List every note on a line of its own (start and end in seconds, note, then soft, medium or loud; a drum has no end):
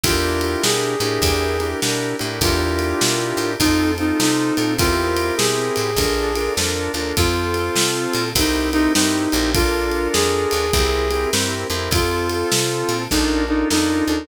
0.03 0.56 E2 loud
0.03 0.95 D4 loud
0.03 0.95 E4 loud
0.03 0.63 F4 medium
0.03 0.95 G4 loud
0.03 0.95 A#4 loud
0.03 kick loud
0.03 ride loud
0.41 ride medium
0.62 0.95 B2 loud
0.62 1.68 G#4 medium
0.62 snare loud
1.00 1.19 A2 loud
1.00 1.57 D4 loud
1.00 1.57 E4 loud
1.00 1.57 G4 loud
1.00 1.57 A#4 loud
1.00 ride medium
1.22 1.74 E2 loud
1.22 kick medium
1.22 ride medium
1.60 1.81 D4 medium
1.60 1.81 E4 medium
1.60 1.81 G4 loud
1.60 1.81 A#4 loud
1.60 ride medium
1.82 2.14 B2 medium
1.82 2.16 D4 loud
1.82 2.16 E4 medium
1.82 2.16 G4 loud
1.82 2.16 A#4 loud
1.82 snare medium
2.19 2.40 A2 medium
2.19 2.40 D4 loud
2.19 2.40 E4 loud
2.19 2.40 G4 loud
2.19 2.40 A#4 medium
2.19 ride medium
2.41 2.94 E2 loud
2.41 3.53 D4 loud
2.41 3.53 E4 loud
2.41 3.50 F4 medium
2.41 3.53 G4 loud
2.41 3.53 A#4 loud
2.41 kick loud
2.41 ride medium
2.79 ride medium
3.01 3.33 B2 loud
3.01 snare loud
3.37 3.56 A2 medium
3.37 ride medium
3.59 4.12 F2 loud
3.59 3.94 C4 loud
3.59 3.91 D#4 medium
3.59 3.94 F4 loud
3.59 3.94 A4 loud
3.59 kick medium
3.59 ride medium
3.97 4.18 C4 medium
3.97 4.20 D#4 medium
3.97 4.18 F4 medium
3.97 4.18 A4 medium
3.97 ride medium
4.20 4.51 C3 medium
4.20 4.54 C4 medium
4.20 4.73 D#4 medium
4.20 4.54 F4 loud
4.20 4.54 A4 loud
4.20 snare medium
4.57 4.77 A#2 medium
4.57 4.77 C4 medium
4.57 4.77 F4 loud
4.57 4.77 A4 loud
4.57 ride medium
4.78 5.31 E2 loud
4.78 5.91 C4 loud
4.78 5.91 E4 loud
4.78 5.35 F4 medium
4.78 5.91 G4 loud
4.78 5.91 A#4 loud
4.78 kick loud
4.78 ride medium
5.17 ride medium
5.37 5.70 B2 medium
5.37 6.52 G#4 medium
5.37 snare loud
5.76 5.96 A2 medium
5.76 ride medium
5.96 6.49 A#1 loud
5.96 6.32 D4 loud
5.96 6.32 F4 loud
5.96 6.32 A4 loud
5.96 6.32 A#4 loud
5.96 kick medium
5.96 ride medium
6.35 6.55 D4 medium
6.35 6.55 F4 loud
6.35 6.55 A4 medium
6.35 6.55 A#4 loud
6.35 ride medium
6.57 6.89 F2 loud
6.57 6.92 D4 loud
6.57 6.92 F4 loud
6.57 6.92 A4 loud
6.57 6.92 A#4 loud
6.57 snare medium
6.94 7.13 D#2 medium
6.94 7.15 D4 loud
6.94 7.15 F4 loud
6.94 7.15 A4 medium
6.94 7.15 A#4 loud
6.94 ride medium
7.17 7.70 F2 loud
7.17 8.29 C4 loud
7.17 8.24 F4 medium
7.17 8.29 F4 loud
7.17 8.29 A4 loud
7.17 kick medium
7.17 ride medium
7.54 ride medium
7.75 8.07 C3 medium
7.75 snare loud
8.13 8.33 A#2 loud
8.13 ride medium
8.35 8.88 C2 loud
8.35 8.70 C4 loud
8.35 8.72 D#4 medium
8.35 8.70 E4 loud
8.35 8.70 G4 loud
8.35 8.70 A#4 loud
8.35 kick medium
8.35 ride loud
8.73 8.93 C4 loud
8.73 8.92 D#4 medium
8.73 8.93 E4 loud
8.73 8.93 G4 medium
8.73 8.93 A#4 loud
8.73 ride medium
8.94 9.27 G2 medium
8.94 9.29 C4 loud
8.94 9.51 D#4 medium
8.94 9.29 E4 loud
8.94 9.29 G4 loud
8.94 9.29 A#4 medium
8.94 snare loud
9.32 10.08 A#1 loud
9.32 9.53 C4 medium
9.32 9.53 E4 medium
9.32 9.53 G4 loud
9.32 9.53 A#4 medium
9.32 ride medium
9.54 10.66 D4 loud
9.54 10.66 F4 loud
9.54 10.08 F4 medium
9.54 10.66 A4 loud
9.54 10.66 A#4 loud
9.54 kick loud
9.54 ride medium
9.91 ride medium
10.13 10.46 F2 medium
10.13 11.30 G#4 medium
10.13 snare medium
10.51 10.71 D#2 medium
10.51 ride medium
10.73 11.26 C2 loud
10.73 11.08 C4 loud
10.73 11.08 E4 loud
10.73 11.08 G4 loud
10.73 11.08 A#4 loud
10.73 kick medium
10.73 ride medium
11.11 11.31 C4 medium
11.11 11.31 E4 medium
11.11 11.31 G4 medium
11.11 11.31 A#4 loud
11.11 ride medium
11.33 11.65 G2 loud
11.33 11.67 C4 loud
11.33 11.67 E4 medium
11.33 11.67 G4 medium
11.33 11.67 A#4 medium
11.33 snare medium
11.70 11.89 F2 loud
11.70 11.90 C4 loud
11.70 11.90 E4 loud
11.70 11.90 G4 medium
11.70 11.90 A#4 medium
11.70 ride medium
11.91 12.44 F2 loud
11.91 13.04 C4 loud
11.91 13.04 F4 loud
11.91 12.98 F4 medium
11.91 13.04 A4 loud
11.91 kick loud
11.91 ride medium
12.29 ride medium
12.51 12.83 C3 medium
12.51 snare loud
12.89 13.08 A#2 medium
12.89 ride medium
13.11 13.64 A#1 loud
13.11 13.45 D4 loud
13.11 13.43 D#4 medium
13.11 13.45 F4 loud
13.11 13.45 A4 loud
13.11 13.45 A#4 loud
13.11 kick medium
13.11 snare medium
13.48 13.69 D4 loud
13.48 13.68 D#4 medium
13.48 13.69 F4 medium
13.48 13.69 A4 medium
13.48 13.69 A#4 medium
13.70 14.02 F2 medium
13.70 14.05 D4 loud
13.70 14.24 D#4 medium
13.70 14.05 F4 loud
13.70 14.05 A4 medium
13.70 14.05 A#4 medium
13.70 snare medium
14.07 14.26 D#2 medium
14.07 14.27 D4 medium
14.07 14.27 F4 medium
14.07 14.27 A4 loud
14.07 14.27 A#4 loud